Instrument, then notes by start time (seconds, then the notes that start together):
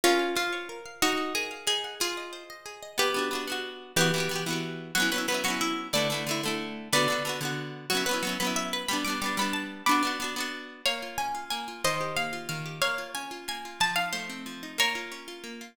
acoustic guitar (steel)
0.04 C#4 F4 A#4
0.19 F5
0.35 F4 C5
0.53 C#5
0.69 A#4
0.86 F5
1.02 D#4 F#4
1.18 F#5
1.35 G#4 A#4
1.51 F5
1.67 D#4 G#4
1.84 F#5
2.00 F4 G#4
2.17 D#5
2.33 C5
2.50 D#5
2.66 G#4
2.83 D#5
2.98 B3 G4 B4
3.14 B3 D4
3.19 F#4
3.31 B3 D4
3.35 F#4
3.47 B3 D4
3.52 F#4
3.96 E3 B3 G4 B4
4.01 F#4
4.14 E3 B3
4.18 F#4 G4
4.29 E3 B3
4.33 F#4 G4
4.46 E3 B3
4.50 F#4 G4
4.95 F#3 B3 F#4
5.00 C#4 E4
5.12 F#3 B3 B4
5.16 C#4 E4
5.28 F#3 B3 B4
5.32 C#4 E4
5.44 F#3 B3 F#4
5.48 C#4 E4
5.61 E4
5.93 D3 A3 B4 D5
5.97 E4
6.10 D3 A3
6.14 E4
6.27 D3 A3
6.31 E4
6.43 D3 A3
6.48 E4
6.93 D3 B3 B4 D5
6.97 F#4
7.08 D3 B3
7.12 F#4
7.25 D3 B3
7.29 F#4
7.41 D3 B3
7.45 F#4
7.90 F#3 B3 F#4
7.95 C#4 E4
8.06 F#3 B3 B4
8.11 C#4 E4
8.23 F#3 B3
8.27 C#4 E4
8.40 F#3 B3 B4
8.45 C#4 E4
8.56 E5
8.73 B4
8.88 G3 B3 B5
8.93 D4
9.05 G3 B3 D6
9.10 D4
9.21 G3 B3 D6
9.26 D4
9.37 G3 B3 B5
9.41 D4
9.53 A5
9.86 B3 D4 B5 D6
9.91 F#4
10.03 B3 D4
10.07 F#4
10.20 B3 D4
10.24 F#4
10.36 B3 D4
10.40 F#4
10.86 A#3 C#5 F5
11.02 F4
11.18 C#4 G#5
11.35 F4
11.50 A#3 G#5
11.68 F4
11.84 D#3 C5 D#5
12.01 G4
12.16 A#3 F5
12.33 F4
12.49 D#3 F5
12.66 G4
12.81 A#3 C#5 F5
12.98 F4
13.15 C#4 G#5
13.31 F4
13.48 A#3 G#5
13.65 F4
13.80 F3 A5
13.96 D#4 F5
14.13 A3 C5
14.30 C4
14.46 F3
14.63 D#4
14.78 A#3 A#4 C#5
14.95 F4
15.12 C#4
15.28 F4
15.44 A#3
15.61 F4